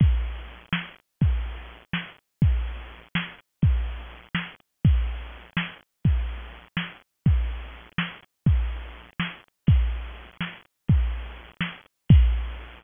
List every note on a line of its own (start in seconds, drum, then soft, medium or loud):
0.00 kick medium
0.00 crash medium
0.24 closed hi-hat medium
0.47 closed hi-hat medium
0.73 snare loud
0.96 closed hi-hat medium
1.21 kick medium
1.21 closed hi-hat medium
1.45 closed hi-hat medium
1.69 closed hi-hat medium
1.93 snare medium
2.42 kick medium
2.42 closed hi-hat medium
2.66 closed hi-hat medium
2.89 closed hi-hat medium
3.15 snare loud
3.38 closed hi-hat medium
3.62 kick medium
3.62 closed hi-hat medium
3.87 closed hi-hat medium
4.11 closed hi-hat medium
4.35 snare medium
4.60 closed hi-hat medium
4.84 kick medium
4.84 crash medium
5.09 closed hi-hat medium
5.32 closed hi-hat medium
5.57 snare loud
5.81 closed hi-hat medium
6.04 kick medium
6.04 closed hi-hat medium
6.29 closed hi-hat medium
6.54 closed hi-hat medium
6.77 snare medium
7.02 closed hi-hat medium
7.26 kick medium
7.26 closed hi-hat medium
7.50 closed hi-hat medium
7.75 closed hi-hat medium
7.98 snare loud
8.23 closed hi-hat medium
8.46 kick medium
8.46 closed hi-hat medium
8.71 closed hi-hat medium
8.95 closed hi-hat medium
9.20 snare medium
9.44 closed hi-hat medium
9.67 kick medium
9.67 crash medium
9.80 closed hi-hat medium
9.92 closed hi-hat medium
10.04 closed hi-hat medium
10.16 closed hi-hat medium
10.28 closed hi-hat medium
10.41 snare medium
10.53 closed hi-hat medium
10.65 closed hi-hat medium
10.88 kick medium
10.88 closed hi-hat loud
11.01 closed hi-hat medium
11.12 closed hi-hat medium
11.25 closed hi-hat medium
11.36 closed hi-hat medium
11.48 closed hi-hat medium
11.61 snare medium
11.73 closed hi-hat medium
11.86 closed hi-hat medium
11.97 closed hi-hat medium
12.09 kick loud
12.09 crash loud